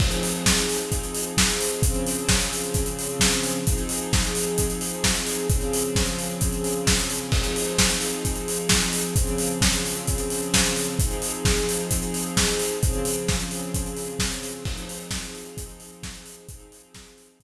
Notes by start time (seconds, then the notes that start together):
0.00 F3 C4 D#4 G#4, kick, crash
0.11 closed hi-hat
0.23 open hi-hat
0.35 closed hi-hat
0.46 kick, snare
0.57 closed hi-hat
0.69 open hi-hat
0.81 closed hi-hat
0.92 kick, closed hi-hat
1.03 closed hi-hat
1.15 open hi-hat
1.26 closed hi-hat
1.37 kick, snare
1.49 closed hi-hat
1.60 open hi-hat
1.72 closed hi-hat
1.82 C#3 F3 C4 G#4, kick, closed hi-hat
1.94 closed hi-hat
2.06 open hi-hat
2.18 closed hi-hat
2.29 kick, snare
2.40 closed hi-hat
2.53 open hi-hat
2.63 closed hi-hat
2.74 kick, closed hi-hat
2.86 closed hi-hat
2.99 open hi-hat
3.09 closed hi-hat
3.20 kick, snare
3.32 closed hi-hat
3.43 open hi-hat
3.54 closed hi-hat
3.66 F3 C4 D#4 G#4, kick, closed hi-hat
3.78 closed hi-hat
3.89 open hi-hat
4.01 closed hi-hat
4.13 kick, snare
4.25 closed hi-hat
4.35 open hi-hat
4.46 closed hi-hat
4.58 kick, closed hi-hat
4.70 closed hi-hat
4.81 open hi-hat
4.93 closed hi-hat
5.04 kick, snare
5.15 closed hi-hat
5.27 open hi-hat
5.38 closed hi-hat
5.50 C#3 F3 C4 G#4, kick, closed hi-hat
5.61 closed hi-hat
5.73 open hi-hat
5.84 closed hi-hat
5.96 kick, snare
6.06 closed hi-hat
6.19 open hi-hat
6.29 closed hi-hat
6.41 kick, closed hi-hat
6.52 closed hi-hat
6.64 open hi-hat
6.75 closed hi-hat
6.87 kick, snare
6.99 closed hi-hat
7.10 open hi-hat
7.21 closed hi-hat
7.32 F3 C4 D#4 G#4, kick, crash
7.44 closed hi-hat
7.56 open hi-hat
7.67 closed hi-hat
7.79 kick, snare
7.90 closed hi-hat
8.01 open hi-hat
8.13 closed hi-hat
8.25 kick, closed hi-hat
8.36 closed hi-hat
8.48 open hi-hat
8.59 closed hi-hat
8.69 kick, snare
8.82 closed hi-hat
8.93 open hi-hat
9.04 closed hi-hat
9.16 C#3 F3 C4 G#4, kick, closed hi-hat
9.27 closed hi-hat
9.38 open hi-hat
9.50 closed hi-hat
9.61 kick, snare
9.73 closed hi-hat
9.86 open hi-hat
9.95 closed hi-hat
10.07 kick, closed hi-hat
10.18 closed hi-hat
10.30 open hi-hat
10.42 closed hi-hat
10.54 kick, snare
10.65 closed hi-hat
10.76 open hi-hat
10.88 closed hi-hat
10.99 F3 C4 D#4 G#4, kick, closed hi-hat
11.11 closed hi-hat
11.22 open hi-hat
11.34 closed hi-hat
11.45 kick, snare
11.57 closed hi-hat
11.69 open hi-hat
11.79 closed hi-hat
11.91 kick, closed hi-hat
12.02 closed hi-hat
12.14 open hi-hat
12.26 closed hi-hat
12.37 kick, snare
12.47 closed hi-hat
12.59 open hi-hat
12.71 closed hi-hat
12.82 C#3 F3 C4 G#4, kick, closed hi-hat
12.93 closed hi-hat
13.05 open hi-hat
13.17 closed hi-hat
13.28 kick, snare
13.40 closed hi-hat
13.51 open hi-hat
13.62 closed hi-hat
13.74 kick, closed hi-hat
13.86 closed hi-hat
13.97 open hi-hat
14.09 closed hi-hat
14.19 kick, snare
14.32 closed hi-hat
14.43 open hi-hat
14.55 closed hi-hat
14.65 F3 C4 D#4 G#4, kick, crash
14.78 closed hi-hat
14.89 open hi-hat
15.00 closed hi-hat
15.11 kick, snare
15.23 closed hi-hat
15.35 open hi-hat
15.45 closed hi-hat
15.57 kick, closed hi-hat
15.69 closed hi-hat
15.80 open hi-hat
15.92 closed hi-hat
16.03 kick, snare
16.15 closed hi-hat
16.26 open hi-hat
16.37 closed hi-hat
16.49 F3 C4 D#4 G#4, kick, closed hi-hat
16.59 closed hi-hat
16.72 open hi-hat
16.83 closed hi-hat
16.94 kick, snare
17.07 closed hi-hat
17.18 open hi-hat
17.29 closed hi-hat
17.40 kick, closed hi-hat